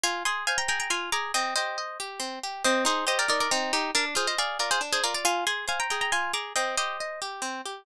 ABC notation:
X:1
M:3/4
L:1/16
Q:1/4=138
K:Cm
V:1 name="Orchestral Harp"
[fa]2 [ac']2 [fa] [gb] [gb] [gb] [ac']2 [bd']2 | [eg]2 [ce]4 z6 | [ce]2 [Ac]2 [ce] [Bd] [Bd] [Bd] [CE]2 [EG]2 | [Bd] z [Ac] [ce] [df]2 [Bd] [Ac] z [Ac] [Bd] [df] |
[fa]2 [ac']2 [fa] [gb] [gb] [gb] [ac']2 [bd']2 | [eg]2 [ce]4 z6 |]
V:2 name="Orchestral Harp"
F2 A2 c2 A2 F2 A2 | C2 G2 e2 G2 C2 G2 | C2 E2 G2 E2 z4 | D2 F2 A2 F2 D2 F2 |
F2 A2 c2 A2 F2 A2 | C2 G2 e2 G2 C2 G2 |]